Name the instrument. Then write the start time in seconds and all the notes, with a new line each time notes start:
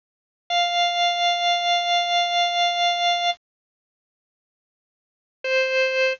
drawbar organ
0.50 F5
5.44 C5